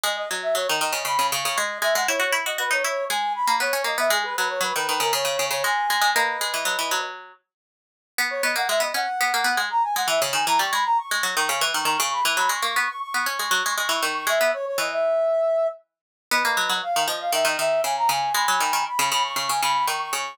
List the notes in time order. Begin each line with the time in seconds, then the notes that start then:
0.03 G#3 D#5
0.17 D#5
0.31 F#3
0.42 E5
0.55 F#3 C#5
0.68 D#3 D#5
0.80 D#3 D#5
0.93 C#3
1.05 C#3 B5
1.19 C#3
1.31 C#3 C#6
1.45 C#3
1.57 G#3 D#5
1.82 G#3 E5
1.95 G#3 F#5
2.08 E4 C#5
2.20 F#4 C#5
2.33 E4
2.46 F#4 D#5
2.58 F#4 B4
2.71 D#4 C#5
2.84 E4 C#5
3.09 G#3 G#5
3.35 B5
3.47 A#3
3.60 B3 C#5
3.73 C#4
3.84 A#3 D#5
3.98 B3 E5
4.10 G#3 G#4
4.24 B4
4.36 F#3 B4
4.50 C#5
4.61 F#3 B4
4.75 D#3 B4
4.88 D#3 B4
5.00 C#3 A#4
5.13 C#3 C#5
5.25 C#3
5.39 C#3
5.51 C#3 C#5
5.64 G#3 G#5
5.90 G#3
6.01 G#3
6.15 A#3 B4 D#5
6.41 G#3
6.54 E3
6.65 F#3
6.79 E3
6.91 F#3
8.18 B3
8.30 C#5
8.43 B3 D#5
8.56 A#3 F#5
8.69 G#3 E5
8.80 B3 D#5
8.94 C#4 F#5
9.21 B3
9.34 A#3
9.44 B3
9.57 G#3
9.70 A#5
9.83 G#5
9.96 G#3 F#5
10.08 E3 E5
10.22 C#3
10.33 D#3 G#5
10.47 E3 A#5
10.59 G3 C#6
10.72 G#3 B5
10.85 A#5
10.97 C#6
11.11 G#3
11.23 F#3
11.37 D#3
11.49 C#3
11.61 E3
11.74 D#3 C#6
11.85 D#3 C#6
11.99 C#3 C#6
12.12 B5
12.25 E3
12.37 F#3 B5
12.49 G#3 C#6
12.63 A#3 C#6
12.76 B3 C#6
12.88 C#6
13.01 C#6
13.14 B3
13.26 C#4
13.39 G#3
13.51 F#3
13.66 G#3
13.77 G#3 C#6
13.89 E3 C#6
14.03 D#3 C#6
14.15 C#6
14.27 G#3 E5
14.41 B3
14.53 C#5
14.66 C#5
14.78 E3 D#5
14.92 E5
16.31 B3 B4 D#5
16.45 A#3
16.57 F#3
16.69 F#3
16.83 F5
16.96 D#3
17.08 F3 D#5
17.20 F5
17.32 D#3 E5
17.45 D#3 D#5
17.59 D#3 E5
17.84 C#3 G#5
17.97 A#5
18.09 C#3 G#5
18.34 G#3 G#5 B5
18.48 F#3
18.60 D#3
18.73 D#3
18.86 B5
18.99 C#3
19.12 C#3 B5
19.24 C#6
19.36 C#3 C#6
19.49 C#3 G#5
19.62 C#3 B5
19.87 D#3 C#6
20.00 C#6
20.13 C#3 C#6